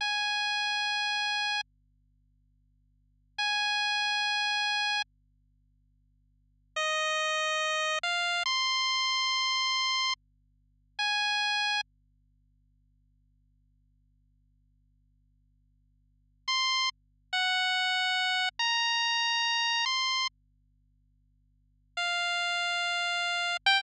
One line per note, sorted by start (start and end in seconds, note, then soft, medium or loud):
0.01 1.61 G#5 medium
3.38 5.02 G#5 medium
6.76 7.99 D#5 medium
8.03 8.43 F5 medium
8.46 10.14 C6 medium
10.99 11.81 G#5 medium
16.48 16.89 C6 medium
17.33 18.49 F#5 medium
18.59 19.85 A#5 medium
19.86 20.27 C6 medium
21.97 23.57 F5 medium
23.66 23.81 G5 loud